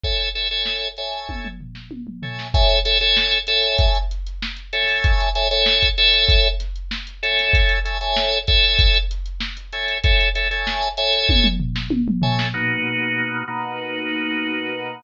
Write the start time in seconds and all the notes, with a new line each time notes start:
0.04 A4 C#5 E5 G#5, kick, closed hi-hat
0.20 closed hi-hat
0.35 A4 C#5 E5 G#5, closed hi-hat
0.51 A4 C#5 E5 G#5, closed hi-hat
0.65 snare
0.83 closed hi-hat
0.97 A4 C#5 E5 G#5, closed hi-hat
1.13 snare, closed hi-hat
1.29 kick, high tom
1.45 mid tom
1.61 floor tom
1.75 snare
1.91 high tom
2.07 mid tom
2.22 A4 C#5 E5 G#5, floor tom
2.39 snare
2.54 A4 C#5 E5 G#5, kick, closed hi-hat
2.69 closed hi-hat
2.85 A4 C#5 E5 G#5, snare, closed hi-hat
3.00 A4 C#5 E5 G#5, snare, closed hi-hat
3.17 snare
3.31 snare, closed hi-hat
3.47 A4 C#5 E5 G#5, closed hi-hat
3.62 closed hi-hat
3.78 kick, closed hi-hat
3.95 closed hi-hat
4.11 closed hi-hat
4.27 closed hi-hat
4.42 snare
4.57 closed hi-hat
4.73 A4 C#5 E5 G#5, closed hi-hat
4.88 open hi-hat
5.04 kick, closed hi-hat
5.20 closed hi-hat
5.35 A4 C#5 E5 G#5, closed hi-hat
5.51 A4 C#5 E5 G#5, closed hi-hat
5.66 snare
5.83 kick, closed hi-hat
5.97 A4 C#5 E5 G#5, snare, closed hi-hat
6.14 closed hi-hat
6.29 kick, closed hi-hat
6.44 closed hi-hat
6.60 snare, closed hi-hat
6.76 closed hi-hat
6.91 snare
7.07 closed hi-hat
7.23 A4 C#5 E5 G#5, closed hi-hat
7.39 closed hi-hat
7.53 kick, closed hi-hat
7.69 snare, closed hi-hat
7.85 A4 C#5 E5 G#5, closed hi-hat
8.01 A4 C#5 E5 G#5, closed hi-hat
8.16 snare
8.33 closed hi-hat
8.47 A4 C#5 E5 G#5, kick, closed hi-hat
8.64 closed hi-hat
8.79 kick, closed hi-hat
8.94 closed hi-hat
9.11 closed hi-hat
9.26 closed hi-hat
9.40 snare
9.57 closed hi-hat
9.73 A4 C#5 E5 G#5, closed hi-hat
9.88 closed hi-hat
10.04 A4 C#5 E5 G#5, kick, closed hi-hat
10.21 closed hi-hat
10.35 A4 C#5 E5 G#5, closed hi-hat
10.51 A4 C#5 E5 G#5, closed hi-hat
10.67 snare
10.83 closed hi-hat
10.97 A4 C#5 E5 G#5, closed hi-hat
11.13 snare, closed hi-hat
11.29 kick, high tom
11.44 mid tom
11.60 floor tom
11.76 snare
11.90 high tom
12.08 mid tom
12.22 A4 C#5 E5 G#5, floor tom
12.39 snare
12.54 B2 A#3 D#4 F#4
13.48 B2 A#3 D#4 F#4